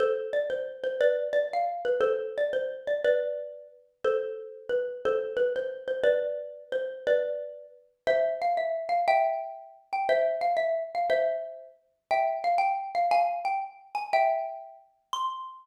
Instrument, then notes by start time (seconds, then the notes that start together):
xylophone
0.00 A4 C5
0.33 D5
0.50 C5
0.84 C5
1.01 B4 D5
1.33 D5
1.53 F5
1.85 B4
2.01 A4 C5
2.38 D5
2.53 C5
2.87 D5
3.04 B4 D5
4.04 A4 C5
4.69 B4
5.05 A4 C5
5.37 B4
5.56 C5
5.88 C5
6.04 B4 D5
6.72 C5
7.07 B4 D5
8.07 C5 E5
8.42 F5
8.57 E5
8.89 F5
9.08 E5 G5
9.93 G5
10.09 C5 E5
10.41 F5
10.57 E5
10.95 F5
11.10 C5 E5
12.11 E5 G5
12.44 F5
12.58 G5
12.95 F5
13.11 F5 G#5
13.45 G5
13.95 G#5
14.13 E5 G5
15.13 C6